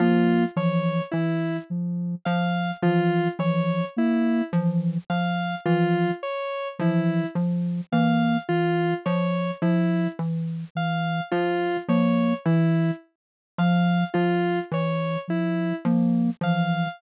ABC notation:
X:1
M:5/4
L:1/8
Q:1/4=53
K:none
V:1 name="Xylophone" clef=bass
F, F, E, z F, F, E, z F, F, | E, z F, F, E, z F, F, E, z | F, F, E, z F, F, E, z F, F, |]
V:2 name="Ocarina"
_B, E, z F, z E, F, B, E, z | F, z E, F, _B, E, z F, z E, | F, _B, E, z F, z E, F, B, E, |]
V:3 name="Lead 1 (square)"
F _d E z f F d E z f | F _d E z f F d E z f | F _d E z f F d E z f |]